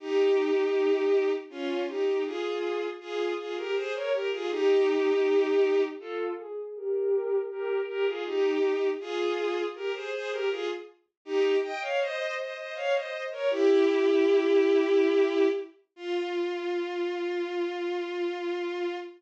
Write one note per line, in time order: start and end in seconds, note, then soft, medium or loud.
0.00 1.31 D#4 medium
0.00 1.31 G4 medium
1.50 1.84 C#4 medium
1.50 1.84 F4 medium
1.88 2.23 D#4 medium
1.88 2.23 G4 medium
2.25 2.86 F4 medium
2.25 2.86 G#4 medium
3.00 3.33 F4 medium
3.00 3.33 G#4 medium
3.38 3.55 F4 medium
3.38 3.55 G#4 medium
3.56 3.74 G4 medium
3.56 3.74 A#4 medium
3.75 3.93 G#4 medium
3.75 3.93 C5 medium
3.94 4.12 A#4 medium
3.94 4.12 C#5 medium
4.12 4.30 G4 medium
4.12 4.30 A#4 medium
4.31 4.49 F4 medium
4.31 4.49 G#4 medium
4.50 5.82 D#4 medium
4.50 5.82 G4 loud
6.00 6.33 F4 medium
6.00 6.33 A4 medium
6.38 6.74 G#4 medium
6.75 7.38 G4 medium
6.75 7.38 A#4 medium
7.50 7.81 G4 medium
7.50 7.81 A#4 medium
7.88 8.05 G4 medium
7.88 8.05 A#4 medium
8.06 8.24 F4 medium
8.06 8.24 G#4 medium
8.25 8.88 D#4 medium
8.25 8.88 G4 medium
9.00 9.63 F4 medium
9.00 9.63 G#4 loud
9.75 9.93 G4 medium
9.75 9.93 A#4 medium
9.94 10.12 G#4 medium
9.94 10.12 C5 medium
10.12 10.30 G#4 medium
10.12 10.30 C5 medium
10.31 10.49 G4 medium
10.31 10.49 A#4 medium
10.50 10.68 F4 medium
10.50 10.68 G#4 medium
11.25 11.55 D#4 medium
11.25 11.55 G4 loud
11.62 11.80 D#5 medium
11.62 11.80 G5 medium
11.81 11.99 C#5 medium
11.81 11.99 F5 medium
12.00 12.35 C5 medium
12.00 12.35 D#5 loud
12.38 12.55 C5 medium
12.38 12.55 D#5 medium
12.56 12.74 C5 medium
12.56 12.74 D#5 medium
12.75 12.93 C#5 medium
12.75 12.93 F5 medium
12.94 13.24 C5 medium
12.94 13.24 D#5 medium
13.31 13.49 A#4 medium
13.31 13.49 C#5 medium
13.50 15.47 E4 medium
13.50 15.47 G4 loud
15.96 18.95 F4 loud